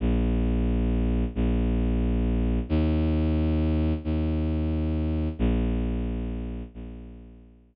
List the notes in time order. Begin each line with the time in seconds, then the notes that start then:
0.00 A#1
1.35 A#1
2.69 D#2
4.04 D#2
5.39 A#1
6.74 A#1